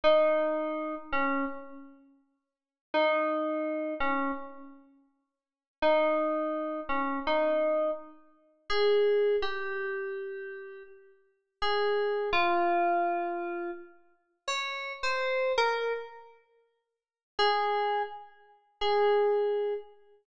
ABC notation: X:1
M:4/4
L:1/16
Q:1/4=83
K:G#m
V:1 name="Electric Piano 2"
D6 C2 z8 | D6 C2 z8 | D6 C2 D4 z4 | [K:Ab] A4 G8 z4 |
A4 F8 z4 | d3 c3 B2 z8 | A4 z4 A6 z2 |]